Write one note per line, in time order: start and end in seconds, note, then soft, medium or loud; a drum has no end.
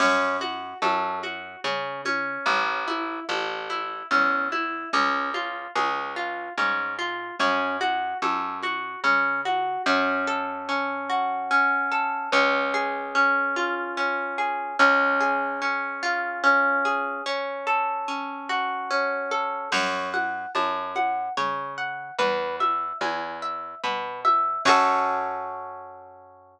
0.00 0.74 F#2 medium
0.00 0.37 C#4 medium
0.00 crash medium
0.00 low conga medium
0.41 0.78 F#4 medium
0.41 high conga medium
0.82 1.56 F#2 medium
0.82 1.19 A4 medium
0.82 high conga medium
1.23 1.60 F#4 medium
1.23 high conga medium
1.64 2.38 C#3 medium
1.64 2.01 C#4 medium
1.64 low conga medium
2.05 2.84 C#4 medium
2.05 high conga medium
2.46 3.20 A1 loud
2.46 low conga medium
2.88 3.24 E4 medium
2.88 high conga medium
3.29 4.03 A1 medium
3.29 3.66 A4 medium
3.29 high conga medium
3.70 4.07 E4 medium
3.70 high conga medium
4.11 4.85 E2 medium
4.11 4.48 C#4 medium
4.11 low conga medium
4.52 4.89 E4 medium
4.52 high conga medium
4.93 5.67 C#2 medium
4.93 5.30 C#4 medium
4.93 low conga medium
5.34 5.71 F4 medium
5.34 high conga medium
5.76 6.49 C#2 medium
5.76 6.13 G#4 medium
5.76 high conga medium
6.16 6.53 F4 medium
6.58 7.32 G#2 medium
6.58 6.95 C#4 medium
6.58 low conga medium
6.99 7.36 F4 medium
7.39 8.14 F#2 medium
7.39 7.77 C#4 medium
7.39 low conga medium
7.81 8.18 F#4 medium
7.81 high conga medium
8.22 8.96 F#2 medium
8.22 8.59 A4 medium
8.22 high conga medium
8.63 9.00 F#4 medium
8.63 high conga medium
9.04 9.78 C#3 medium
9.04 9.41 C#4 medium
9.04 low conga medium
9.45 9.82 F#4 medium
9.45 high conga medium
9.86 12.13 F#2 loud
9.86 10.68 C#4 medium
10.27 11.91 A4 medium
10.69 11.50 C#4 medium
11.10 12.27 F#4 medium
11.51 12.29 C#4 medium
11.92 12.31 A4 medium
12.32 14.59 C#2 loud
12.32 13.14 C#4 loud
12.74 14.38 G#4 medium
13.15 13.97 C#4 medium
13.56 14.73 F4 medium
13.97 14.75 C#4 medium
14.38 14.77 G#4 medium
14.79 17.07 C#2 loud
14.79 15.61 C#4 loud
15.20 16.85 G#4 medium
15.62 16.43 C#4 medium
16.03 17.20 F4 medium
16.44 17.22 C#4 medium
16.85 17.24 G#4 medium
17.26 18.08 C#4 loud
17.67 19.31 A4 medium
18.08 18.90 C#4 medium
18.49 19.66 F#4 medium
18.91 19.69 C#4 medium
19.31 19.70 A4 medium
19.72 20.46 F#2 loud
19.72 20.10 C#5 medium
19.72 crash loud
19.72 low conga medium
20.14 20.51 F#5 medium
20.14 high conga medium
20.55 21.29 F#2 medium
20.55 20.92 A5 medium
20.55 high conga medium
20.96 21.33 F#5 medium
20.96 high conga medium
21.37 22.11 C#3 medium
21.37 21.74 C#5 medium
21.37 low conga medium
21.78 22.15 F#5 medium
22.18 22.92 E2 medium
22.18 22.56 B4 medium
22.18 low conga medium
22.60 22.97 E5 medium
22.60 high conga medium
23.01 23.75 E2 medium
23.01 23.38 G#5 medium
23.01 high conga medium
23.42 23.79 E5 medium
23.84 24.58 B2 medium
23.84 24.21 B4 medium
23.84 low conga medium
24.25 24.62 E5 medium
24.25 high conga medium
24.65 26.60 F#2 loud
24.65 26.60 C#4 medium
24.65 26.60 F#4 loud
24.65 26.60 A4 medium
24.65 kick loud
24.65 crash loud